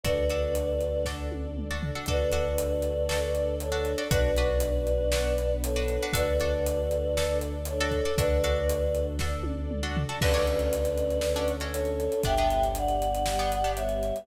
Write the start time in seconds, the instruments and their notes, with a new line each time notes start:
0.03 synth bass 2 D2, string ensemble 1 D4 F#4 A4, pizzicato strings D4 F#4 A4, choir aahs B4 D5, kick, closed hi-hat
0.30 pizzicato strings D4 F#4 A4, closed hi-hat
0.55 closed hi-hat
0.81 closed hi-hat
1.05 pizzicato strings D4 F#4 A4, string ensemble 1 D4 A4 D5, kick, snare
1.32 high tom
1.57 mid tom
1.71 pizzicato strings D4 F#4 A4
1.83 floor tom
1.95 pizzicato strings D4 F#4 A4
2.06 synth bass 2 D2, pizzicato strings D4 F#4 A4, string ensemble 1 D4 F#4 A4, choir aahs B4 D5, kick, closed hi-hat
2.32 pizzicato strings D4 F#4 A4, closed hi-hat
2.58 closed hi-hat
2.82 closed hi-hat
3.09 pizzicato strings D4 F#4 A4, string ensemble 1 D4 A4 D5, snare
3.35 closed hi-hat
3.60 choir aahs A4 C#5, closed hi-hat
3.72 pizzicato strings D4 F#4 A4
3.85 closed hi-hat
3.98 pizzicato strings D4 F#4 A4
4.11 synth bass 2 B1, pizzicato strings D4 F#4 B4, string ensemble 1 D4 F#4 B4, choir aahs B4 D5, kick, closed hi-hat
4.36 pizzicato strings D4 F#4 B4, closed hi-hat
4.60 closed hi-hat
4.87 closed hi-hat
5.12 string ensemble 1 B3 D4 B4, pizzicato strings D4 F#4 B4, snare
5.38 closed hi-hat
5.64 choir aahs A4 C#5, closed hi-hat
5.76 pizzicato strings D4 F#4 B4
5.88 closed hi-hat
6.02 pizzicato strings D4 F#4 B4
6.13 synth bass 2 D2, pizzicato strings D4 F#4 A4, string ensemble 1 D4 F#4 A4, choir aahs B4 D5, kick, closed hi-hat
6.40 pizzicato strings D4 F#4 A4, closed hi-hat
6.66 closed hi-hat
6.91 closed hi-hat
7.16 string ensemble 1 D4 A4 D5, pizzicato strings D4 F#4 A4, snare
7.41 closed hi-hat
7.65 choir aahs A4 C#5, closed hi-hat
7.80 pizzicato strings D4 F#4 A4
7.91 kick, closed hi-hat
8.05 pizzicato strings D4 F#4 A4
8.17 synth bass 2 D2, string ensemble 1 D4 F#4 A4, pizzicato strings D4 F#4 A4, choir aahs B4 D5, kick, closed hi-hat
8.44 pizzicato strings D4 F#4 A4, closed hi-hat
8.69 closed hi-hat
8.95 closed hi-hat
9.19 string ensemble 1 D4 A4 D5, pizzicato strings D4 F#4 A4, kick, snare
9.43 high tom
9.71 mid tom
9.83 pizzicato strings D4 F#4 A4
9.97 floor tom
10.09 pizzicato strings D4 F#4 A4
10.21 synth bass 2 D2, string ensemble 1 C#4 D4 F#4 A4, pizzicato strings C#4 D4 F#4 A4, choir aahs B4 D5, kick, crash
10.34 pizzicato strings C#4 D4 F#4 A4, closed hi-hat
10.47 closed hi-hat
10.59 closed hi-hat
10.73 closed hi-hat
10.85 closed hi-hat
10.98 closed hi-hat
11.10 closed hi-hat
11.21 string ensemble 1 C#4 D4 A4 C#5, snare
11.36 pizzicato strings C#4 D4 F#4 A4, closed hi-hat
11.48 closed hi-hat
11.60 pizzicato strings C#4 D4 F#4 A4, closed hi-hat
11.73 choir aahs A4 C#5, closed hi-hat
11.85 closed hi-hat
12.00 closed hi-hat
12.12 closed hi-hat
12.23 synth bass 2 G1, string ensemble 1 B3 D4 G4, pizzicato strings B3 D4 G4, choir aahs E5 G5, kick, closed hi-hat
12.38 pizzicato strings B3 D4 G4, closed hi-hat
12.50 closed hi-hat
12.63 closed hi-hat
12.75 choir aahs D5 F#5, closed hi-hat
12.88 closed hi-hat
13.02 closed hi-hat
13.15 closed hi-hat
13.26 string ensemble 1 G3 B3 G4, snare
13.39 pizzicato strings B3 D4 G4, closed hi-hat
13.52 closed hi-hat
13.64 pizzicato strings B3 D4 G4, closed hi-hat
13.76 choir aahs C#5 E5, closed hi-hat
13.89 closed hi-hat
14.03 closed hi-hat
14.16 closed hi-hat